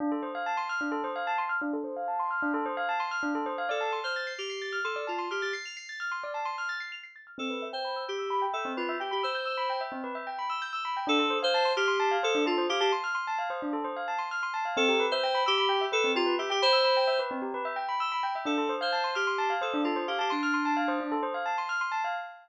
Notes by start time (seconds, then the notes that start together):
0.00 D4
0.12 A4
0.23 C5
0.35 F5
0.46 A5
0.57 C6
0.69 F6
0.81 D4
0.92 A4
1.04 C5
1.16 F5
1.27 A5
1.38 C6
1.49 F6
1.61 D4
1.73 A4
1.84 C5
1.96 F5
2.08 A5
2.19 C6
2.31 F6
2.42 D4
2.54 A4
2.66 C5
2.77 F5
2.89 A5
3.00 C6
3.11 F6
3.23 D4
3.35 A4
3.46 C5
3.58 F5
3.69 A4 D5
3.81 A5
3.92 C6
4.04 C5 F6
4.16 A6
4.27 C7
4.38 G4 F7
4.50 C7
4.62 A6
4.72 F6
4.84 A4 C6
4.96 D5
5.07 F4 A5
5.18 C6
5.31 G4 F6
5.42 G4 A6
5.53 C7
5.65 F7
5.77 C7
5.89 A6
6.00 F6
6.12 C6
6.24 D5
6.34 A5
6.45 C6
6.58 F6
6.69 A6
6.80 C7
6.92 F7
7.03 C7
7.16 A6
7.27 F6
7.38 C4 A4
7.50 B4
7.62 E5
7.73 C5 G5
7.85 B5
7.96 E6
8.08 G4 G6
8.18 E6
8.30 B5
8.42 G5
8.53 A4 E5
8.65 C4
8.77 F4 B4
8.89 E5
9.00 G4 G5
9.11 G4 B5
9.23 C5 E6
9.35 G6
9.45 E6
9.57 B5
9.70 G5
9.81 E5
9.92 C4
10.04 B4
10.15 E5
10.27 G5
10.39 B5
10.50 E6
10.62 G6
10.73 E6
10.85 B5
10.97 G5
11.07 D4 A4
11.19 A4
11.30 C5
11.43 C5 F5
11.54 A5
11.65 C6
11.76 G4 F6
11.88 C6
12.00 A5
12.11 F5
12.23 A4 C5
12.35 D4
12.46 F4 A4
12.58 C5
12.69 G4 F5
12.80 G4 A5
12.92 C6
13.04 F6
13.15 C6
13.27 A5
13.39 F5
13.50 C5
13.62 D4
13.73 A4
13.84 C5
13.96 F5
14.08 A5
14.18 C6
14.31 F6
14.43 C6
14.54 A5
14.65 F5
14.77 C4 A4
14.88 G4
15.00 B4
15.11 C5 E5
15.23 G5
15.35 B5
15.46 G4 E6
15.58 B5
15.69 G5
15.81 E5
15.92 A4 B4
16.04 C4
16.15 F4 G4
16.26 B4
16.38 G4 E5
16.50 G4 G5
16.62 C5 B5
16.73 E6
16.84 B5
16.97 G5
17.07 E5
17.19 B4
17.31 C4
17.42 G4
17.54 B4
17.65 E5
17.76 G5
17.89 B5
18.00 E6
18.12 B5
18.23 G5
18.35 E5
18.45 D4 A4
18.58 A4
18.69 C5
18.81 C5 F5
18.92 A5
19.04 C6
19.15 G4 F6
19.27 C6
19.38 A5
19.50 F5
19.61 A4 C5
19.74 D4
19.84 F4 A4
19.96 C5
20.07 G4 F5
20.19 G4 A5
20.30 D4 C6
20.43 F6
20.54 C6
20.65 A5
20.77 F5
20.88 C5
21.00 D4
21.12 A4
21.23 C5
21.34 F5
21.46 A5
21.58 C6
21.69 F6
21.81 C6
21.92 A5
22.04 F5